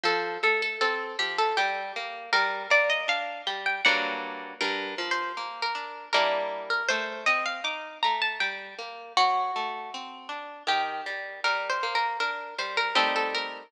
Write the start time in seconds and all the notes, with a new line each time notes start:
0.03 F3 A4
0.43 A3 A4
0.62 A4
0.81 C4 A4
1.19 F3 G4
1.38 A4
1.57 G3 G4
1.96 A#3
2.33 G3 A#4
2.70 A#3 D5
2.90 D#5
3.08 D4 F5
3.47 G3 G5
3.66 G5
3.85 G2 F#3 A#3 D4 F#5
4.61 G2 A#4
4.98 F3
5.11 C5
5.37 A#3
5.62 A#4
5.75 D4
6.13 G3 A#3 D4 E4 A#4
6.70 A#4
6.89 A3 C5
7.26 C4 D#5
7.46 F5
7.64 D#4 D6
8.03 A3 A#5
8.22 A5
8.40 G3 G5
8.79 A#3
9.17 F#3 F#4
9.56 A3
9.94 C4
10.29 D4
10.67 D#3 G4
11.06 G3
11.44 G3 A#4
11.70 C5
11.83 A#3
11.95 A#4
12.20 D4 A#4
12.58 G3 C5
12.77 A#4
12.95 G3 A3 C4 D#4 A4
13.16 A4
13.35 A#4